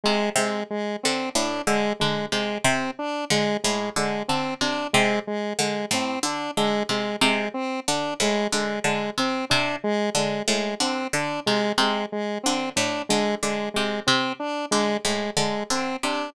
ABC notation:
X:1
M:5/4
L:1/8
Q:1/4=92
K:none
V:1 name="Pizzicato Strings" clef=bass
C, C, z D, A,, D, D, C, C, z | D, A,, D, D, C, C, z D, A,, D, | D, C, C, z D, A,, D, D, C, C, | z D, A,, D, D, C, C, z D, A,, |
D, D, C, C, z D, A,, D, D, C, |]
V:2 name="Lead 1 (square)"
^G, G, G, C D G, G, G, C D | ^G, G, G, C D G, G, G, C D | ^G, G, G, C D G, G, G, C D | ^G, G, G, C D G, G, G, C D |
^G, G, G, C D G, G, G, C D |]